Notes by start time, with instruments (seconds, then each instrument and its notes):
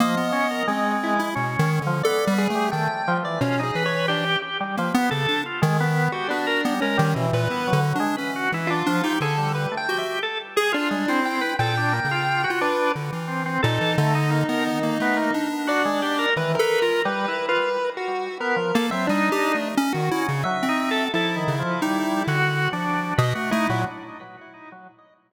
0.00 drawbar organ F3, lead 1 (square) A#3 D#5
0.17 lead 1 (square) B3
0.32 drawbar organ C#4
0.51 drawbar organ A#4
0.67 drawbar organ G#3, lead 1 (square) C4
1.03 lead 1 (square) E4
1.19 lead 1 (square) E4
1.35 lead 1 (square) B2, drawbar organ C#4
1.59 lead 1 (square) D#3
1.82 lead 1 (square) D3
1.87 drawbar organ F3
2.03 drawbar organ B3, lead 1 (square) A4 D5
2.27 lead 1 (square) G3
2.38 lead 1 (square) G#4
2.50 lead 1 (square) A3
2.55 drawbar organ G3
2.71 lead 1 (square) D#3 G5, drawbar organ A3
3.08 drawbar organ F3
3.23 drawbar organ E3, lead 1 (square) D5
3.41 lead 1 (square) B2 C#4, drawbar organ F4
3.59 drawbar organ D#4, lead 1 (square) G#4
3.75 lead 1 (square) E3, drawbar organ B4
3.86 lead 1 (square) C#5
4.08 lead 1 (square) D4, drawbar organ G4
4.42 drawbar organ G4
4.60 drawbar organ G3
4.77 drawbar organ F3, lead 1 (square) A#3
4.94 drawbar organ B3, lead 1 (square) B3
5.11 lead 1 (square) C#3, drawbar organ A4
5.28 lead 1 (square) D4
5.46 drawbar organ F4
5.62 lead 1 (square) D#3, drawbar organ G#3
5.80 drawbar organ B3
6.12 lead 1 (square) F#4, drawbar organ G4
6.28 drawbar organ B3, lead 1 (square) D4 F#4
6.47 drawbar organ A#4
6.65 drawbar organ G3, lead 1 (square) B3
6.81 lead 1 (square) G#3 C#4, drawbar organ A#4
6.98 lead 1 (square) D#3, drawbar organ G3
7.14 lead 1 (square) B2, drawbar organ E3
7.33 lead 1 (square) A#2 B4
7.50 lead 1 (square) B3, drawbar organ E4
7.67 drawbar organ F#3
7.73 lead 1 (square) D3
7.95 lead 1 (square) D4
8.00 drawbar organ G#3
8.17 lead 1 (square) C#4, drawbar organ B4
8.36 drawbar organ F#4
8.52 lead 1 (square) E3, drawbar organ E4
8.67 drawbar organ D4, lead 1 (square) F4
8.86 drawbar organ F3, lead 1 (square) D4
9.03 lead 1 (square) D#4, drawbar organ G4
9.20 lead 1 (square) D3 A4, drawbar organ G#4
9.37 drawbar organ G3
9.55 lead 1 (square) B4
9.72 drawbar organ A3
9.77 lead 1 (square) G5
9.89 lead 1 (square) F#4, drawbar organ G4
9.98 lead 1 (square) E5
10.23 drawbar organ A4
10.56 drawbar organ G#4, lead 1 (square) G#4
10.72 lead 1 (square) D4 F4, drawbar organ F4
10.90 lead 1 (square) G3, drawbar organ G#3
11.08 drawbar organ C4, lead 1 (square) E4
11.25 lead 1 (square) G5
11.41 drawbar organ B4
11.59 lead 1 (square) A#2 G5, drawbar organ A4
11.77 drawbar organ D4
11.92 drawbar organ A#3
12.05 lead 1 (square) C#3
12.11 drawbar organ F4
12.44 drawbar organ F#4
12.50 lead 1 (square) F4
12.61 drawbar organ D4, lead 1 (square) B4
12.95 lead 1 (square) D3
13.12 lead 1 (square) E3
13.28 drawbar organ C4
13.46 drawbar organ C4
13.63 lead 1 (square) A#2 D#4, drawbar organ A4
13.81 lead 1 (square) E3
13.98 lead 1 (square) D3, drawbar organ A3
14.15 drawbar organ D#4
14.31 drawbar organ A#3
14.48 lead 1 (square) B3, drawbar organ A#4
14.66 drawbar organ D#3
14.83 lead 1 (square) A#3
15.00 lead 1 (square) A3, drawbar organ B3
15.16 drawbar organ A#3
15.34 lead 1 (square) D4
15.67 drawbar organ F#4, lead 1 (square) D5
15.85 drawbar organ G#3
16.02 drawbar organ G4
16.19 drawbar organ A#4
16.36 lead 1 (square) D#3 B4, drawbar organ E3
16.55 lead 1 (square) A#4
16.59 lead 1 (square) A4, drawbar organ B4
16.82 lead 1 (square) F4, drawbar organ A#4
17.05 drawbar organ G3, lead 1 (square) B4
17.28 drawbar organ E4
17.49 drawbar organ F4, lead 1 (square) B4
17.97 lead 1 (square) F#4
18.40 drawbar organ B3, lead 1 (square) A#4
18.56 drawbar organ F3
18.75 lead 1 (square) A#3, drawbar organ A4
18.91 lead 1 (square) F#3 E5, drawbar organ C4
19.07 lead 1 (square) G3 D4, drawbar organ D#4
19.32 lead 1 (square) G4
19.55 lead 1 (square) A3
19.77 lead 1 (square) C#4
19.93 lead 1 (square) D#3 F#4
20.11 drawbar organ C#4, lead 1 (square) E4
20.28 lead 1 (square) C#3
20.44 drawbar organ F#3, lead 1 (square) E5
20.62 lead 1 (square) C4
20.69 drawbar organ D#4
20.91 drawbar organ A4
21.14 lead 1 (square) F3 E4, drawbar organ A4
21.35 drawbar organ D#3
21.48 lead 1 (square) C#3
21.59 drawbar organ F3
21.82 drawbar organ G3, lead 1 (square) D#4
22.27 lead 1 (square) D3, drawbar organ F#4
22.73 lead 1 (square) F3, drawbar organ D4
23.18 lead 1 (square) B2 D#5, drawbar organ B4
23.35 lead 1 (square) A3, drawbar organ F#4
23.51 lead 1 (square) A3 E4, drawbar organ D#4
23.69 lead 1 (square) A#2, drawbar organ F#3